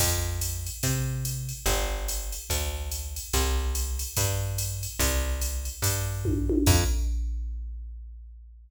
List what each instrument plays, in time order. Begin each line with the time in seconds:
0.00 electric bass (finger) F2, kick, crash, ride
0.41 hi-hat pedal, ride
0.66 ride
0.83 electric bass (finger) C3, kick, ride
1.25 hi-hat pedal, ride
1.49 ride
1.66 electric bass (finger) G1, kick, ride
2.08 hi-hat pedal, ride
2.32 ride
2.50 electric bass (finger) D2, kick, ride
2.91 hi-hat pedal, ride
3.16 ride
3.33 electric bass (finger) C2, kick, ride
3.75 hi-hat pedal, ride
3.99 ride
4.16 electric bass (finger) G2, kick, ride
4.58 hi-hat pedal, ride
4.83 ride
4.99 electric bass (finger) C2, kick, ride
5.41 hi-hat pedal, ride
5.65 ride
5.82 electric bass (finger) G2, kick, ride
6.25 kick, high tom
6.49 high tom
6.66 electric bass (finger) F2, kick, crash